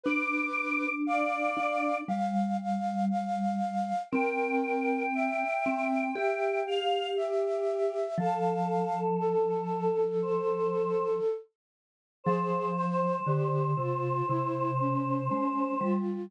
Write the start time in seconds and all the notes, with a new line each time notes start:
0.04 D4 B4 D6
1.06 D5 F5
1.57 D4
2.08 G3 F5
2.60 F5
3.10 F5
4.11 C4 A#4 G5
5.14 E5
5.66 C4
6.15 G4 E5 G5
6.66 F5
7.16 G4 E5
8.18 F3 A4 F5
9.20 A4
10.22 C5
12.24 F3 G#4 C5
12.76 C5
13.27 D3 G4
13.77 C3 F4
14.27 C3 E4
14.80 C#4
15.29 G#3 C#4
15.81 G3 F4